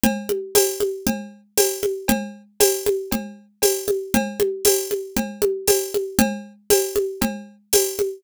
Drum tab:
TB |--x---x-|--x---x-|--x---x-|--x---x-|
CB |x-x-x-x-|x-x-x-x-|x-x-x-x-|x-x-x-x-|
CG |OoooO-oo|O-ooO-oo|OoooOooo|O-ooO-oo|